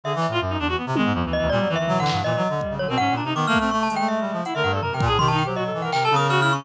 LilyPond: <<
  \new Staff \with { instrumentName = "Clarinet" } { \time 2/4 \tempo 4 = 163 \tuplet 3/2 { d8 e8 a,8 } fis,8 e,8 | r16 c16 dis16 gis,16 f,16 d,8 d,16 | ais,16 fis16 dis8 \tuplet 3/2 { fis8 d8 g,8 } | \tuplet 3/2 { ais,8 fis8 d8 } r16 cis16 d16 b,16 |
\tuplet 3/2 { gis,8 ais,8 c8 dis8 a8 a8 } | a8 a16 a16 \tuplet 3/2 { a8 g8 f8 } | r16 d16 g,8 fis,16 c16 ais,16 a,16 | dis8. fis8. e8 |
c8 cis4. | }
  \new Staff \with { instrumentName = "Clarinet" } { \time 2/4 gis'16 r8 f'16 r16 dis'16 d'16 fis'16 | b16 r16 gis8 \tuplet 3/2 { f8 e8 e8 } | g8 e16 e4~ e16 | e16 e16 r8 g8 fis16 c'16 |
cis'8 d'16 dis'16 \tuplet 3/2 { b8 ais8 c'8 } | r8 gis4. | e'16 ais'8 a'16 \tuplet 3/2 { ais'8 ais'8 gis'8 } | \tuplet 3/2 { g'8 dis'8 g'8 } fis'16 a'8 ais'16 |
\tuplet 3/2 { ais'8 a'8 ais'8 fis'8 e'8 cis'8 } | }
  \new Staff \with { instrumentName = "Glockenspiel" } { \time 2/4 e''4. r8 | r4. dis''8 | \tuplet 3/2 { d''4 e''4 fis''4 } | dis''4. cis''16 ais'16 |
fis''8 ais''8 \tuplet 3/2 { d'''8 f'''8 f'''8 } | \tuplet 3/2 { cis'''8 a''8 g''8 } e''4 | fis''16 e''16 fis''16 d''16 \tuplet 3/2 { ais''8 g''8 a''8 } | c'''16 a''16 g''16 c''16 dis''8. fis''16 |
\tuplet 3/2 { g''8 a''8 dis'''8 f'''8 f'''8 cis'''8 } | }
  \new DrumStaff \with { instrumentName = "Drums" } \drummode { \time 2/4 r8 cb8 r4 | r8 tommh8 r4 | r4 tomfh8 hc8 | r4 bd4 |
r4 r8 bd8 | r8 hh8 r4 | hh4 tomfh8 bd8 | tomfh4 r4 |
hc8 tommh8 cb4 | }
>>